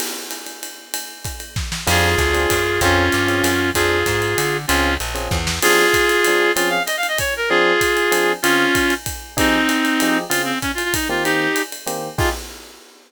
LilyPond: <<
  \new Staff \with { instrumentName = "Clarinet" } { \time 3/4 \key f \minor \tempo 4 = 192 r2. | r2. | <f' aes'>2. | <des' f'>2. |
<f' aes'>2. | <des' f'>4 r2 | <f' aes'>2. | f'8 f''8 \tuplet 3/2 { ees''8 f''8 ees''8 } des''8 bes'8 |
<f' aes'>2. | <des' f'>2 r4 | <c' ees'>2. | f'8 c'8 \tuplet 3/2 { des'8 f'8 f'8 } ees'8 f'8 |
<ees' g'>4. r4. | f'4 r2 | }
  \new Staff \with { instrumentName = "Electric Piano 1" } { \time 3/4 \key f \minor r2. | r2. | <c' d' f' aes'>4. <c' d' f' aes'>4. | <c' des' f' aes'>4. <c' des' f' aes'>4. |
<c' d' f' aes'>2. | <c' des' f' aes'>4. <c' des' f' aes'>4. | <f c' d' aes'>2 <f c' d' aes'>4 | <f c' des' aes'>2. |
<f c' d' aes'>2 <f c' d' aes'>4 | <des c' f' aes'>2. | <f ees' g' aes'>2 <f ees' g' aes'>4 | <des c' f' aes'>2~ <des c' f' aes'>8 <ees bes c' g'>8~ |
<ees bes c' g'>2 <ees bes c' g'>4 | <ees' f' g' aes'>4 r2 | }
  \new Staff \with { instrumentName = "Electric Bass (finger)" } { \clef bass \time 3/4 \key f \minor r2. | r2. | f,4 d,4 ges,4 | f,4 g,4 ges,4 |
f,4 aes,4 d4 | des,4 bes,,4 e,4 | r2. | r2. |
r2. | r2. | r2. | r2. |
r2. | r2. | }
  \new DrumStaff \with { instrumentName = "Drums" } \drummode { \time 3/4 <cymc cymr>4 <hhp cymr>8 cymr8 cymr4 | cymr4 <hhp bd cymr>8 cymr8 <bd sn>8 sn8 | <cymc cymr>4 <hhp bd cymr>8 cymr8 <bd cymr>4 | <bd cymr>4 <hhp cymr>8 cymr8 cymr4 |
<bd cymr>4 <hhp bd cymr>8 cymr8 cymr4 | cymr4 <hhp cymr>8 cymr8 <bd sn>8 sn8 | <cymc cymr>4 <hhp bd cymr>8 cymr8 cymr4 | cymr4 <hhp cymr>8 cymr8 <bd cymr>4 |
r4 <hhp bd cymr>8 cymr8 cymr4 | cymr4 <hhp bd cymr>8 cymr8 <bd cymr>4 | <bd cymr>4 <hhp cymr>8 cymr8 cymr4 | cymr4 <hhp bd cymr>8 cymr8 <bd cymr>4 |
cymr4 <hhp cymr>8 cymr8 cymr4 | <cymc bd>4 r4 r4 | }
>>